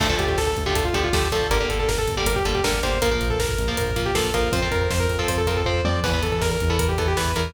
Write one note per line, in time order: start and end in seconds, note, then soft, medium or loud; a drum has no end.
0.00 0.16 D2 medium
0.00 0.08 D3 medium
0.00 0.08 F3 medium
0.00 0.08 A3 medium
0.00 0.15 A4 medium
0.00 kick medium
0.00 crash medium
0.09 0.40 D3 medium
0.09 0.40 F3 medium
0.09 0.40 A3 medium
0.09 kick medium
0.19 0.36 D2 medium
0.19 0.28 G4 medium
0.19 kick medium
0.19 closed hi-hat medium
0.28 0.37 G4 medium
0.28 kick medium
0.37 0.53 D2 medium
0.37 0.47 A4 medium
0.37 kick medium
0.37 snare medium
0.47 0.63 A4 medium
0.47 kick medium
0.57 0.73 D2 medium
0.57 kick medium
0.57 closed hi-hat medium
0.66 0.89 D3 medium
0.66 0.89 F3 medium
0.66 0.89 A3 medium
0.66 0.75 G4 medium
0.66 kick medium
0.75 0.91 D2 medium
0.75 0.84 A4 medium
0.75 kick medium
0.75 closed hi-hat medium
0.85 0.94 F4 medium
0.85 kick medium
0.93 1.09 D2 medium
0.93 1.09 D3 medium
0.93 1.09 F3 medium
0.93 1.09 A3 medium
0.93 1.03 G4 medium
0.93 kick medium
0.93 closed hi-hat medium
1.04 1.13 F4 medium
1.04 kick medium
1.13 1.29 D2 medium
1.13 1.28 D3 medium
1.13 1.28 F3 medium
1.13 1.28 A3 medium
1.13 1.29 G4 medium
1.13 kick medium
1.13 snare medium
1.23 kick medium
1.32 1.48 D2 medium
1.32 1.47 D3 medium
1.32 1.47 F3 medium
1.32 1.47 A3 medium
1.32 1.49 A4 medium
1.32 kick medium
1.32 closed hi-hat medium
1.42 kick medium
1.50 1.66 G1 medium
1.50 1.58 D3 medium
1.50 1.58 G3 medium
1.50 1.58 A#3 medium
1.50 1.66 A#4 medium
1.50 kick medium
1.50 closed hi-hat medium
1.60 1.91 D3 medium
1.60 1.91 G3 medium
1.60 1.91 A#3 medium
1.60 kick medium
1.69 1.85 G1 medium
1.69 1.79 A4 medium
1.69 kick medium
1.69 closed hi-hat medium
1.79 1.88 A4 medium
1.79 kick medium
1.88 2.05 G1 medium
1.88 1.97 A#4 medium
1.88 kick medium
1.88 snare medium
1.98 2.15 A4 medium
1.98 kick medium
2.08 2.25 G1 medium
2.08 kick medium
2.08 closed hi-hat medium
2.17 2.40 D3 medium
2.17 2.40 G3 medium
2.17 2.40 A#3 medium
2.17 2.26 G4 medium
2.17 kick medium
2.26 2.42 G1 medium
2.26 2.35 A#4 medium
2.26 kick medium
2.26 closed hi-hat medium
2.36 2.45 G4 medium
2.36 kick medium
2.45 2.61 G1 medium
2.45 2.60 D3 medium
2.45 2.60 G3 medium
2.45 2.60 A#3 medium
2.45 2.54 A4 medium
2.45 kick medium
2.45 closed hi-hat medium
2.55 2.64 G4 medium
2.55 kick medium
2.64 2.80 G1 medium
2.64 2.79 D3 medium
2.64 2.79 G3 medium
2.64 2.79 A#3 medium
2.64 2.81 A#4 medium
2.64 kick medium
2.64 snare medium
2.74 kick medium
2.83 3.00 G1 medium
2.83 2.98 D3 medium
2.83 2.98 G3 medium
2.83 2.98 A#3 medium
2.83 2.99 C5 medium
2.83 kick medium
2.83 closed hi-hat medium
2.92 kick medium
3.02 3.18 A#1 medium
3.02 3.10 F3 medium
3.02 3.10 A#3 medium
3.02 3.11 A#4 medium
3.02 kick medium
3.02 closed hi-hat medium
3.11 3.42 F3 medium
3.11 3.42 A#3 medium
3.11 3.28 A#4 medium
3.11 kick medium
3.21 3.37 A#1 medium
3.21 kick medium
3.21 closed hi-hat medium
3.30 3.39 A4 medium
3.30 kick medium
3.39 3.55 A#1 medium
3.39 3.76 A#4 medium
3.39 kick medium
3.39 snare medium
3.49 kick medium
3.58 3.75 A#1 medium
3.58 kick medium
3.58 closed hi-hat medium
3.68 3.91 F3 medium
3.68 3.91 A#3 medium
3.68 kick medium
3.77 3.93 A#1 medium
3.77 4.01 A#4 medium
3.77 kick medium
3.77 closed hi-hat medium
3.87 kick medium
3.96 4.12 A#1 medium
3.96 4.11 F3 medium
3.96 4.11 A#3 medium
3.96 kick medium
3.96 closed hi-hat medium
4.06 4.15 G4 medium
4.06 kick medium
4.14 4.31 A#1 medium
4.14 4.30 F3 medium
4.14 4.30 A#3 medium
4.14 4.33 A4 medium
4.14 kick medium
4.14 snare medium
4.25 kick medium
4.34 4.51 A#1 medium
4.34 4.49 F3 medium
4.34 4.49 A#3 medium
4.34 4.52 A#4 medium
4.34 kick medium
4.34 closed hi-hat medium
4.43 kick medium
4.52 4.68 F2 medium
4.52 4.60 F3 medium
4.52 4.60 C4 medium
4.52 4.69 C5 medium
4.52 kick medium
4.52 closed hi-hat medium
4.62 4.93 F3 medium
4.62 4.93 C4 medium
4.62 kick medium
4.71 4.87 F2 medium
4.71 4.81 A#4 medium
4.71 kick medium
4.71 closed hi-hat medium
4.81 4.90 A#4 medium
4.81 kick medium
4.90 5.07 F2 medium
4.90 5.00 C5 medium
4.90 kick medium
4.90 snare medium
5.00 5.17 A#4 medium
5.00 kick medium
5.09 5.25 F2 medium
5.09 kick medium
5.09 closed hi-hat medium
5.19 5.41 F3 medium
5.19 5.41 C4 medium
5.19 5.28 A4 medium
5.19 kick medium
5.28 5.45 F2 medium
5.28 5.37 C5 medium
5.28 kick medium
5.28 closed hi-hat medium
5.38 5.47 A4 medium
5.38 kick medium
5.47 5.63 F2 medium
5.47 5.62 F3 medium
5.47 5.62 C4 medium
5.47 5.56 A#4 medium
5.47 kick medium
5.47 closed hi-hat medium
5.57 5.66 A4 medium
5.57 kick medium
5.65 5.81 F2 medium
5.65 5.81 F3 medium
5.65 5.81 C4 medium
5.65 5.81 C5 medium
5.65 kick medium
5.65 floor tom medium
5.84 6.00 F2 medium
5.84 6.00 F3 medium
5.84 6.00 C4 medium
5.84 6.00 D5 medium
5.84 high tom medium
6.04 6.20 E2 loud
6.04 6.11 E3 medium
6.04 6.11 B3 medium
6.04 6.21 B4 medium
6.04 kick medium
6.04 crash medium
6.13 6.44 E3 medium
6.13 6.44 B3 medium
6.13 kick medium
6.23 6.40 E2 medium
6.23 6.32 A4 medium
6.23 kick medium
6.23 closed hi-hat medium
6.32 6.41 A4 medium
6.32 kick medium
6.41 6.57 E2 medium
6.41 6.51 A#4 medium
6.41 kick medium
6.41 snare medium
6.51 6.69 A#4 medium
6.51 kick medium
6.60 6.78 E2 medium
6.60 kick medium
6.60 closed hi-hat medium
6.70 6.92 E3 medium
6.70 6.92 B3 medium
6.70 6.79 A4 medium
6.70 kick medium
6.79 6.95 E2 medium
6.79 6.88 A#4 medium
6.79 kick medium
6.79 closed hi-hat medium
6.89 6.98 G4 medium
6.89 kick medium
6.98 7.14 E2 medium
6.98 7.13 E3 medium
6.98 7.13 B3 medium
6.98 7.07 A4 medium
6.98 kick medium
6.98 closed hi-hat medium
7.08 7.17 G4 medium
7.08 kick medium
7.17 7.34 E2 medium
7.17 7.32 E3 medium
7.17 7.32 B3 medium
7.17 7.34 B4 medium
7.17 kick medium
7.17 snare medium
7.26 kick medium
7.36 7.52 E2 medium
7.36 7.51 E3 medium
7.36 7.51 B3 medium
7.36 7.51 A#4 medium
7.36 kick medium
7.36 closed hi-hat medium
7.45 kick medium